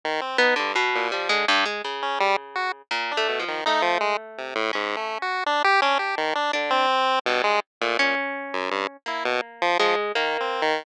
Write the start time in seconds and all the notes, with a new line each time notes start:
0.05 D#3
0.21 C4
0.38 B3 D#4
0.56 G2 D3
0.75 B2
0.95 A#2
1.12 F3 G3
1.29 D3 G#3
1.48 G2
1.66 G#3
1.84 C#3
2.02 C#4
2.20 G3
2.55 F#4
2.91 A#2
3.11 D4
3.17 A3
3.28 B2
3.39 F3
3.48 D#3
3.66 A3 D#4
3.82 F3
4.00 G#3
4.38 C3
4.55 A2
4.73 G#2 C#4
4.97 A3
5.22 F#4
5.46 D4
5.64 G4
5.82 C#4 D4
5.99 G4
6.17 D#3
6.35 D4
6.53 D3 D4
6.70 C4
7.26 G2 B2
7.44 G#3
7.81 A#2 A3
7.99 A#2 C#4
8.53 F#2
8.71 G2
9.06 A#3 E4
9.25 B2
9.62 F3
9.79 F3 G#3
10.15 D#3 A#3
10.40 C4
10.62 D#3